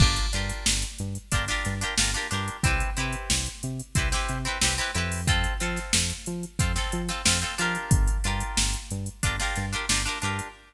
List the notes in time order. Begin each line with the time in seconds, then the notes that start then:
0.00 G1 D4 F4 G4 A#4, kick, crash
0.16 closed hi-hat
0.33 G2 D4 F4 G4 A#4, closed hi-hat
0.49 closed hi-hat
0.66 G1, snare
0.82 closed hi-hat
0.98 G2, closed hi-hat
1.15 closed hi-hat
1.32 G1 D4 F4 G4 A#4, kick, closed hi-hat
1.48 D4 F4 G4 A#4, snare, closed hi-hat
1.65 G2, snare, closed hi-hat
1.81 D4 F4 G4 A#4, closed hi-hat
1.98 G1 D4 F4 G4 A#4, snare
2.14 D4 F4 G4 A#4, snare, closed hi-hat
2.31 G2 D4 F4 G4 A#4, snare, closed hi-hat
2.48 closed hi-hat
2.63 C2 C4 E4 G4 B4, kick, closed hi-hat
2.80 closed hi-hat
2.97 C3 C4 E4 G4 B4, closed hi-hat
3.13 closed hi-hat
3.30 C2, snare
3.46 closed hi-hat
3.63 C3, closed hi-hat
3.80 closed hi-hat
3.95 C2 C4 E4 G4 B4, kick, closed hi-hat
4.12 C4 E4 G4 B4, snare, closed hi-hat
4.29 C3, closed hi-hat
4.45 C4 E4 G4 B4, closed hi-hat
4.61 C2 C4 E4 G4 B4, snare
4.78 C4 E4 G4 B4, closed hi-hat
4.95 F2 C4 E4 G4 B4, closed hi-hat
5.12 open hi-hat
5.27 C4 F4 A4, kick, closed hi-hat
5.44 closed hi-hat
5.60 F3 C4 F4 A4, closed hi-hat
5.76 snare, closed hi-hat
5.93 F2, snare
6.10 closed hi-hat
6.26 F3, closed hi-hat
6.43 closed hi-hat
6.59 F2 C4 F4 A4, kick, closed hi-hat
6.76 C4 F4 A4, snare, closed hi-hat
6.92 F3, closed hi-hat
7.09 C4 F4 A4, snare, closed hi-hat
7.25 F2 C4 F4 A4, snare
7.41 C4 F4 A4, closed hi-hat
7.58 F3 D4 F4 G4 A#4, snare, closed hi-hat
7.75 closed hi-hat
7.91 G1, kick, closed hi-hat
8.08 closed hi-hat
8.24 G2 D4 F4 G4 A#4, closed hi-hat
8.40 closed hi-hat
8.57 G1, snare
8.73 closed hi-hat
8.91 G2, closed hi-hat
9.06 closed hi-hat
9.23 G1 D4 F4 G4 A#4, kick, closed hi-hat
9.40 D4 F4 G4 A#4, snare, closed hi-hat
9.55 G2, snare, closed hi-hat
9.73 D4 F4 G4 A#4, closed hi-hat
9.89 G1 D4 F4 G4 A#4, snare
10.05 D4 F4 G4 A#4, closed hi-hat
10.22 G2 D4 F4 G4 A#4, closed hi-hat
10.39 closed hi-hat